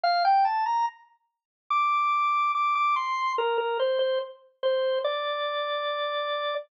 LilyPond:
\new Staff { \time 4/4 \key c \mixolydian \tempo 4 = 72 f''16 g''16 a''16 bes''16 r4 d'''4 d'''16 d'''16 c'''8 | bes'16 bes'16 c''16 c''16 r8 c''8 d''2 | }